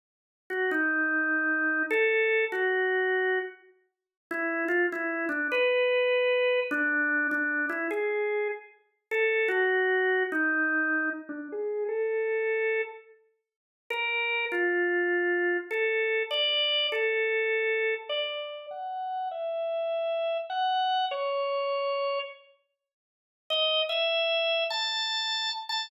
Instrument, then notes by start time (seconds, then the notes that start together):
drawbar organ
0.50 F#4
0.71 D#4
1.91 A4
2.52 F#4
4.31 E4
4.68 F4
4.92 E4
5.29 D4
5.52 B4
6.71 D4
7.31 D4
7.69 E4
7.91 G#4
9.11 A4
9.48 F#4
10.32 D#4
11.29 D4
11.52 G#4
11.88 A4
13.90 A#4
14.52 F4
15.71 A4
16.31 D5
16.92 A4
18.09 D5
18.71 F#5
19.31 E5
20.50 F#5
21.11 C#5
23.50 D#5
23.89 E5
24.70 A5
25.69 A5